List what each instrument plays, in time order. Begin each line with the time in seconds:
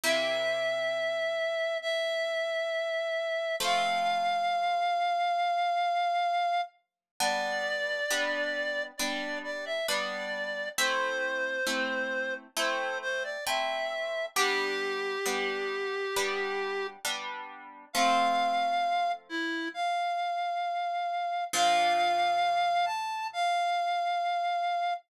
0.04 orchestral harp C3 A#3 E4 G4, clarinet E5
1.82 clarinet E5
3.60 orchestral harp F3 A3 C4, clarinet F5
7.20 orchestral harp G3 B3 D4, clarinet D5
8.10 orchestral harp G3 B3 D4
8.98 orchestral harp G3 B3 D4, clarinet D5
9.44 clarinet D5
9.66 clarinet E5
9.88 orchestral harp G3 B3 D4, clarinet D5
10.78 orchestral harp A3 C4 E4, clarinet C5
11.67 orchestral harp A3 C4 E4
12.57 orchestral harp A3 C4 E4, clarinet C5
13.02 clarinet C5
13.24 clarinet D5
13.46 orchestral harp A3 C4 E4, clarinet E5
14.36 orchestral harp G3 B3 D4, clarinet G4
15.26 orchestral harp G3 B3 D4
16.16 orchestral harp G3 B3 D4
17.05 orchestral harp G3 B3 D4
17.93 orchestral harp F3 A3 C4, clarinet F5
19.29 clarinet E4
19.74 clarinet F5
21.53 orchestral harp A#2 F3 D4, clarinet F5
22.86 clarinet A5
23.33 clarinet F5